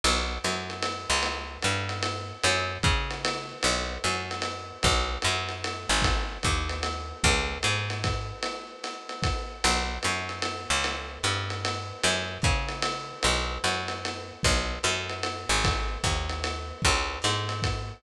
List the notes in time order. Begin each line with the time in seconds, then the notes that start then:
0.04 B1, ride
0.44 F#2, hi-hat pedal, ride
0.70 ride
0.82 ride
1.10 C#2
1.23 ride
1.62 G2, hi-hat pedal, ride
1.89 ride
2.03 ride
2.43 F#2, ride
2.83 C#3, kick, hi-hat pedal, ride
3.10 ride
3.25 ride
3.63 B1, ride
4.04 F#2, hi-hat pedal, ride
4.31 ride
4.42 ride
4.83 B1, kick, ride
5.22 F#2, hi-hat pedal, ride
5.49 ride
5.64 ride
5.89 G#1
6.02 kick, ride
6.43 D#2, kick, hi-hat pedal, ride
6.69 ride
6.83 ride
7.24 C#2, kick, ride
7.63 G#2, hi-hat pedal, ride
7.90 ride
8.04 kick, ride
8.43 ride
8.84 hi-hat pedal, ride
9.09 ride
9.23 kick, ride
9.64 B1, ride
10.03 F#2, hi-hat pedal, ride
10.29 ride
10.42 ride
10.70 C#2
10.84 ride
11.23 G2, hi-hat pedal, ride
11.50 ride
11.65 ride
12.03 F#2, ride
12.42 C#3, kick, hi-hat pedal, ride
12.69 ride
12.82 ride
13.23 B1, ride
13.64 F#2, hi-hat pedal, ride
13.88 ride
14.05 ride
14.43 B1, kick, ride
14.83 F#2, hi-hat pedal, ride
15.09 ride
15.23 ride
15.49 G#1
15.64 kick, ride
16.04 D#2, kick, hi-hat pedal, ride
16.29 ride
16.44 ride
16.82 C#2, kick, ride
17.22 G#2, hi-hat pedal, ride
17.49 ride
17.62 kick, ride